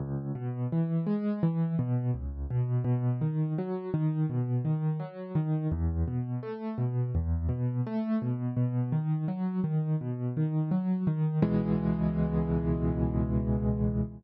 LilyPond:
\new Staff { \time 4/4 \key cis \minor \tempo 4 = 84 cis,8 b,8 e8 gis8 e8 b,8 cis,8 b,8 | b,8 dis8 fis8 dis8 b,8 dis8 fis8 dis8 | e,8 b,8 a8 b,8 e,8 b,8 a8 b,8 | b,8 dis8 fis8 dis8 b,8 dis8 fis8 dis8 |
<cis, b, e gis>1 | }